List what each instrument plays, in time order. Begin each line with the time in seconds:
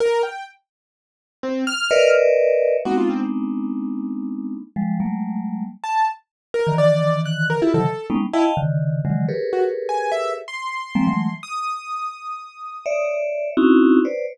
0.00 acoustic grand piano A#4
0.23 acoustic grand piano G5
1.43 acoustic grand piano C4
1.67 acoustic grand piano F6
1.91 vibraphone A#4 B4 C#5 D5 D#5 E5
2.85 vibraphone G#3 A#3 B3 C4 D4 D#4, acoustic grand piano F#4
2.97 acoustic grand piano F4
3.10 acoustic grand piano C4
4.76 vibraphone F3 G3 G#3
5.00 vibraphone F#3 G3 G#3 A3 A#3
5.84 acoustic grand piano A5
6.54 acoustic grand piano A#4
6.67 vibraphone D3 D#3 E3
6.78 acoustic grand piano D5
7.25 acoustic grand piano F#6
7.50 acoustic grand piano A#4
7.62 vibraphone E4 F4 G4 A4, acoustic grand piano E4
7.74 vibraphone C3 C#3 D#3 E3 F#3, acoustic grand piano A4
8.10 vibraphone G3 G#3 A#3 B3 C#4 D#4
8.33 acoustic grand piano E4, vibraphone D#5 F5 G5 A5
8.57 vibraphone C#3 D3 D#3
9.05 vibraphone C#3 D3 D#3 E3 F#3 G#3
9.28 vibraphone G4 G#4 A4 A#4 B4 C#5
9.53 acoustic grand piano F#4
9.89 acoustic grand piano G#5
10.12 acoustic grand piano E5
10.48 acoustic grand piano C6
10.95 vibraphone F3 G3 G#3 A#3 C4
11.07 vibraphone E3 F#3 G#3 A3
11.43 acoustic grand piano D#6
12.86 vibraphone C#5 D5 E5
13.57 vibraphone C4 C#4 D#4 E4 F#4
14.05 vibraphone B4 C5 C#5 D5